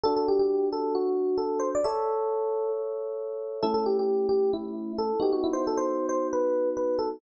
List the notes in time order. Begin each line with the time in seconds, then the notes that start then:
0.03 D4 F#4 A4
0.16 A4
0.28 G4
0.39 G4
0.72 A4
0.95 F#4
1.37 A4
1.59 C5
1.75 D5
1.84 A4 C#5 E5
3.62 A3 C#4 E4 A4
3.74 A4
3.86 G4
3.99 G4
4.29 G4
4.53 E4
4.98 A4
5.20 B3 D#4 F#4 G4
5.33 F#4
5.44 E4
5.53 C5
5.67 A4
5.77 C5
6.09 C5
6.33 B4
6.77 B4
6.99 A4